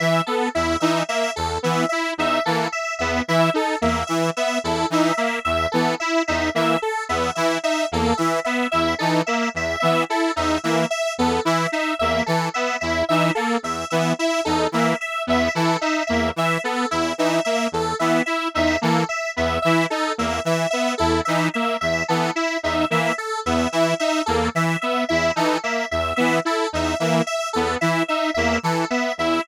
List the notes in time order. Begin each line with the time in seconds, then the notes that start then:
0.00 E3 E5
0.26 B3 A4
0.55 E2 E4 E5
0.80 E3 D#4 E5
1.09 A#3 E5
1.36 E2 A4
1.63 E3 B3 E5
1.89 E4 E5
2.18 E2 D#4 E5
2.45 E3 A#3 A4
2.72 E5
2.99 E2 B3 E5
3.28 E3 E4 E5
3.54 D#4 A4
3.81 E2 A#3 E5
4.07 E3 E5
4.37 B3 E5
4.64 E2 E4 A4
4.90 E3 D#4 E5
5.17 A#3 E5
5.45 E2 E5
5.72 E3 B3 A4
6.00 E4 E5
6.28 E2 D#4 E5
6.55 E3 A#3 E5
6.82 A4
7.09 E2 B3 E5
7.35 E3 E4 E5
7.63 D#4 E5
7.92 E2 A#3 A4
8.17 E3 E5
8.45 B3 E5
8.71 E2 E4 E5
8.99 E3 D#4 A4
9.26 A#3 E5
9.54 E2 E5
9.80 E3 B3 E5
10.09 E4 A4
10.36 E2 D#4 E5
10.64 E3 A#3 E5
10.90 E5
11.18 E2 B3 A4
11.45 E3 E4 E5
11.72 D#4 E5
11.99 E2 A#3 E5
12.26 E3 A4
12.54 B3 E5
12.81 E2 E4 E5
13.09 E3 D#4 E5
13.35 A#3 A4
13.63 E2 E5
13.90 E3 B3 E5
14.19 E4 E5
14.45 E2 D#4 A4
14.72 E3 A#3 E5
15.01 E5
15.27 E2 B3 E5
15.55 E3 E4 A4
15.81 D#4 E5
16.07 E2 A#3 E5
16.36 E3 E5
16.64 B3 A4
16.91 E2 E4 E5
17.18 E3 D#4 E5
17.45 A#3 E5
17.72 E2 A4
17.99 E3 B3 E5
18.26 E4 E5
18.54 E2 D#4 E5
18.81 E3 A#3 A4
19.09 E5
19.36 E2 B3 E5
19.62 E3 E4 E5
19.90 D#4 A4
20.18 E2 A#3 E5
20.45 E3 E5
20.70 B3 E5
20.98 E2 E4 A4
21.25 E3 D#4 E5
21.54 A#3 E5
21.81 E2 E5
22.08 E3 B3 A4
22.35 E4 E5
22.63 E2 D#4 E5
22.90 E3 A#3 E5
23.18 A4
23.46 E2 B3 E5
23.72 E3 E4 E5
23.99 D#4 E5
24.26 E2 A#3 A4
24.55 E3 E5
24.81 B3 E5
25.09 E2 E4 E5
25.36 E3 D#4 A4
25.64 A#3 E5
25.91 E2 E5
26.16 E3 B3 E5
26.45 E4 A4
26.73 E2 D#4 E5
27.00 E3 A#3 E5
27.27 E5
27.53 E2 B3 A4
27.81 E3 E4 E5
28.08 D#4 E5
28.34 E2 A#3 E5
28.63 E3 A4
28.90 B3 E5
29.18 E2 E4 E5